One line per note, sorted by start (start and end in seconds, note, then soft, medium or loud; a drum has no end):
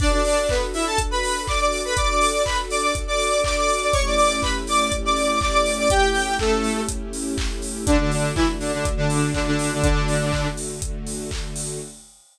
0.00 1.94 D4 medium
0.00 0.11 D4 medium
0.00 1.94 F#4 loud
0.00 1.94 A4 medium
0.00 0.11 D5 medium
0.00 kick loud
0.00 crash medium
0.12 0.24 D4 medium
0.12 0.24 D5 medium
0.24 0.46 D4 medium
0.24 0.46 D5 medium
0.24 open hi-hat medium
0.49 0.61 B3 medium
0.49 0.61 B4 medium
0.49 kick medium
0.49 clap loud
0.74 0.85 E4 medium
0.74 0.85 E5 medium
0.74 open hi-hat medium
0.86 0.98 A4 medium
0.86 0.98 A5 medium
0.98 kick medium
0.98 closed hi-hat loud
1.11 1.41 B4 medium
1.11 1.41 B5 medium
1.23 open hi-hat medium
1.47 1.60 D5 medium
1.47 1.60 D6 medium
1.47 kick medium
1.47 clap medium
1.60 1.82 D5 medium
1.60 1.82 D6 medium
1.72 open hi-hat medium
1.85 1.97 B4 medium
1.85 1.97 B5 medium
1.95 3.90 D4 medium
1.95 3.90 F#4 medium
1.95 3.90 A4 loud
1.95 2.08 D5 medium
1.95 2.08 D6 medium
1.95 kick medium
1.95 closed hi-hat loud
2.10 2.20 D5 medium
2.10 2.20 D6 medium
2.20 2.43 D5 medium
2.20 2.43 D6 medium
2.20 open hi-hat medium
2.45 2.57 B4 medium
2.45 2.57 B5 medium
2.45 kick medium
2.45 clap loud
2.70 2.82 D5 medium
2.70 2.82 D6 medium
2.70 open hi-hat medium
2.83 2.94 D5 medium
2.83 2.94 D6 medium
2.95 kick medium
2.95 closed hi-hat medium
3.07 3.42 D5 medium
3.07 3.42 D6 medium
3.20 open hi-hat medium
3.44 3.56 D5 medium
3.44 3.56 D6 medium
3.44 kick medium
3.44 clap loud
3.56 3.80 D5 medium
3.56 3.80 D6 medium
3.69 open hi-hat medium
3.82 3.94 D5 medium
3.82 3.94 D6 medium
3.93 5.88 A3 medium
3.93 5.88 C#4 medium
3.93 5.88 E4 medium
3.93 5.88 G4 medium
3.93 4.04 C#5 medium
3.93 4.04 C#6 medium
3.93 kick medium
3.93 closed hi-hat medium
4.06 4.16 D5 medium
4.06 4.16 D6 medium
4.17 4.39 D5 medium
4.17 4.39 D6 medium
4.17 open hi-hat medium
4.42 4.54 B4 medium
4.42 4.54 B5 medium
4.42 kick medium
4.42 clap medium
4.67 4.80 D5 medium
4.67 4.80 D6 medium
4.67 open hi-hat medium
4.80 4.92 D5 medium
4.80 4.92 D6 medium
4.92 kick medium
4.92 closed hi-hat medium
5.05 5.39 D5 medium
5.05 5.39 D6 medium
5.16 open hi-hat medium
5.41 5.52 D5 medium
5.41 5.52 D6 medium
5.41 kick medium
5.41 clap medium
5.53 5.73 D5 medium
5.53 5.73 D6 medium
5.66 open hi-hat medium
5.78 5.90 D5 medium
5.78 5.90 D6 medium
5.90 7.85 A3 medium
5.90 7.85 C#4 loud
5.90 7.85 E4 medium
5.90 7.85 G4 medium
5.90 6.33 G4 medium
5.90 6.33 G5 medium
5.90 kick medium
5.90 closed hi-hat loud
6.15 open hi-hat medium
6.39 6.81 A3 medium
6.39 6.81 A4 medium
6.39 kick medium
6.39 clap loud
6.64 open hi-hat medium
6.89 kick medium
6.89 closed hi-hat loud
7.13 open hi-hat medium
7.38 kick medium
7.38 clap loud
7.62 open hi-hat medium
7.86 7.98 D3 medium
7.86 9.81 D3 medium
7.86 9.81 A3 medium
7.86 7.98 D4 loud
7.86 9.81 F#4 medium
7.86 kick loud
7.86 closed hi-hat loud
7.99 8.11 D3 medium
7.99 8.11 D4 medium
8.11 8.32 D3 medium
8.11 8.32 D4 medium
8.11 open hi-hat medium
8.35 8.47 E3 medium
8.35 8.47 E4 medium
8.35 kick medium
8.35 clap loud
8.60 8.72 D3 medium
8.60 8.72 D4 medium
8.60 open hi-hat medium
8.74 8.85 D3 medium
8.74 8.85 D4 medium
8.85 kick medium
8.85 closed hi-hat medium
8.97 9.30 D3 medium
8.97 9.30 D4 medium
9.10 open hi-hat medium
9.34 9.46 D3 medium
9.34 9.46 D4 medium
9.34 kick medium
9.34 clap medium
9.47 9.71 D3 medium
9.47 9.71 D4 medium
9.59 open hi-hat medium
9.73 9.82 D3 medium
9.73 9.82 D4 medium
9.82 10.48 D3 medium
9.82 11.79 D3 medium
9.82 11.79 A3 medium
9.82 10.48 D4 medium
9.82 11.79 F#4 medium
9.82 kick loud
9.82 closed hi-hat loud
10.08 open hi-hat medium
10.33 kick medium
10.33 clap medium
10.57 open hi-hat medium
10.82 kick medium
10.82 closed hi-hat loud
11.07 open hi-hat medium
11.31 kick medium
11.31 clap loud
11.56 open hi-hat medium